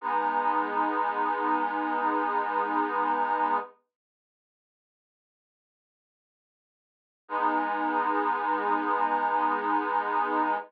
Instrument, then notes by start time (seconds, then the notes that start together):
accordion
0.01 G#3 B3 D#4
7.28 G#3 B3 D#4